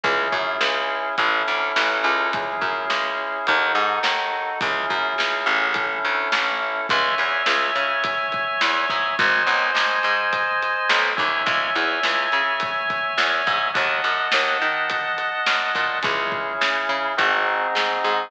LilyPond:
<<
  \new Staff \with { instrumentName = "Drawbar Organ" } { \time 4/4 \key cis \minor \tempo 4 = 105 <cis' e' gis'>2 <cis' e' a'>2 | <cis' e' gis'>2 <dis' fis' a'>2 | <cis' e' gis'>2 <cis' e' a'>2 | <cis'' e'' gis''>1 |
<bis' dis'' gis''>2.~ <bis' dis'' gis''>8 <cis'' e'' gis''>8~ | <cis'' e'' gis''>1 | <dis'' fis'' a''>1 | <cis' e' gis'>2 <bis dis' fis' gis'>2 | }
  \new Staff \with { instrumentName = "Electric Bass (finger)" } { \clef bass \time 4/4 \key cis \minor cis,8 fis,8 cis,4 a,,8 d,8 a,,8 cis,8~ | cis,8 fis,8 cis,4 dis,8 gis,8 dis,4 | cis,8 fis,8 cis,8 a,,4 d,8 a,,4 | cis,8 e,8 cis,8 cis4. e,8 gis,8 |
gis,,8 b,,8 gis,,8 gis,4. b,,8 dis,8 | cis,8 e,8 cis,8 cis4. e,8 gis,8 | dis,8 fis,8 dis,8 dis4. fis,8 ais,8 | cis,4 cis8 cis8 gis,,4 gis,8 gis,8 | }
  \new DrumStaff \with { instrumentName = "Drums" } \drummode { \time 4/4 <hh bd>8 bd8 sn4 <hh bd>4 sn4 | <hh bd>8 bd8 sn4 <hh bd>4 sn4 | <hh bd>8 bd8 sn4 <hh bd>4 sn4 | <hh bd>8 hh8 sn8 hh8 <hh bd>8 <hh bd>8 sn8 <hh bd>8 |
<hh bd>8 hh8 sn8 hh8 <hh bd>8 hh8 sn8 <hh bd>8 | <hh bd>8 hh8 sn8 hh8 <hh bd>8 <hh bd>8 sn8 <hh bd>8 | <hh bd>8 hh8 sn8 hh8 <hh bd>8 hh8 sn8 <hh bd>8 | <hh bd>8 bd8 sn4 <hh bd>4 sn4 | }
>>